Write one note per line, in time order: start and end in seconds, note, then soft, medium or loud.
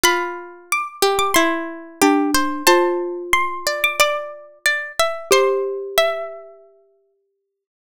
0.04 0.83 F4 medium
0.04 0.65 B5 medium
0.72 1.15 D6 medium
1.02 1.34 G4 medium
1.19 1.34 D6 medium
1.34 2.00 E4 medium
1.34 2.59 C6 medium
2.02 2.63 D4 medium
2.02 2.31 G4 medium
2.34 2.67 C5 medium
2.67 5.02 F4 medium
2.67 3.55 C5 medium
2.67 3.23 A5 medium
3.33 3.80 C6 medium
3.67 3.98 D5 medium
3.84 3.99 D6 medium
4.00 4.59 D5 medium
4.00 5.28 D6 medium
4.66 4.92 D5 medium
4.99 5.29 E5 medium
5.31 7.64 G4 loud
5.31 7.38 C5 medium
5.31 5.88 C6 medium
5.98 7.14 E5 medium